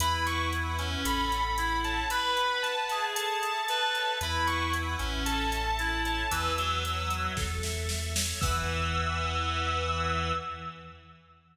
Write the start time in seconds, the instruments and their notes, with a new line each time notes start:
0.00 synth bass 2 E2, clarinet E4, drawbar organ B4, distortion guitar B5, closed hi-hat
0.26 drawbar organ F#5, distortion guitar C#6, closed hi-hat
0.52 drawbar organ B4, closed hi-hat
0.78 clarinet C#4, drawbar organ E5, closed hi-hat
1.05 synth bass 2 A1, drawbar organ A4, distortion guitar B5, closed hi-hat
1.32 drawbar organ F#5, closed hi-hat
1.57 clarinet E4, drawbar organ A4, closed hi-hat
1.84 drawbar organ C#5, distortion guitar A5, closed hi-hat
2.10 drawbar organ B4, clarinet B4, distortion guitar B5, closed hi-hat
2.37 drawbar organ F#5, closed hi-hat
2.63 drawbar organ B4, distortion guitar A5, closed hi-hat
2.89 clarinet G#4, drawbar organ E5, closed hi-hat
3.15 drawbar organ A4, distortion guitar A5, closed hi-hat
3.42 drawbar organ E5, distortion guitar A5, closed hi-hat
3.68 drawbar organ A4, clarinet B4, closed hi-hat
3.95 drawbar organ C#5, closed hi-hat
4.21 synth bass 2 E2, clarinet E4, drawbar organ B4, distortion guitar B5, closed hi-hat
4.47 drawbar organ F#5, distortion guitar C#6, closed hi-hat
4.73 drawbar organ B4, closed hi-hat
4.98 synth bass 2 A1, clarinet C#4, drawbar organ E5, closed hi-hat
5.26 drawbar organ A4, distortion guitar A5, closed hi-hat
5.52 drawbar organ E5, closed hi-hat
5.79 clarinet E4, drawbar organ A4, closed hi-hat
6.05 drawbar organ C#5, distortion guitar A5, closed hi-hat
6.31 synth bass 2 E2, clarinet E3, drawbar organ B4, distortion guitar E6, closed hi-hat
6.57 clarinet F#3, drawbar organ F#5, closed hi-hat
6.84 drawbar organ B4, closed hi-hat
7.10 drawbar organ E5, closed hi-hat
7.37 synth bass 2 E2, drawbar organ A4, kick, snare
7.63 drawbar organ E5, snare
7.89 drawbar organ A4, snare
8.16 drawbar organ C#5, snare
8.41 synth bass 2 E2, clarinet E3, drawbar organ B4 E5 F#5, distortion guitar E6, kick, crash